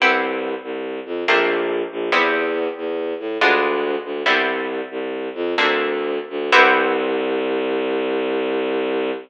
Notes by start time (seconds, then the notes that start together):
0.00 C2 B3 C4 E4 G4
0.63 C2
1.06 F2
1.28 A#1 A3 A#3 C4 D4
1.91 A#1
2.12 E2 G3 B3 C4 E4
2.77 E2
3.20 A2
3.41 D2 G#3 B3 D4 F4
4.05 D2
4.26 C2 G3 B3 C4 E4
4.91 C2
5.35 F2
5.58 D2 A3 A#3 C4 D4
6.30 D2
6.52 C2 B3 C4 E4 G4